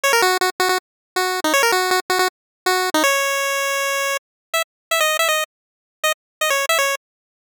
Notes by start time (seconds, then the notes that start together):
0.04 C#5
0.13 A#4
0.22 F#4
0.41 F#4
0.60 F#4
0.69 F#4
1.16 F#4
1.44 D#4
1.54 C#5
1.63 A#4
1.72 F#4
1.91 F#4
2.10 F#4
2.19 F#4
2.66 F#4
2.94 D#4
3.04 C#5
4.54 E5
4.91 E5
5.00 D#5
5.19 E5
5.29 D#5
6.04 D#5
6.41 D#5
6.50 C#5
6.69 E5
6.79 C#5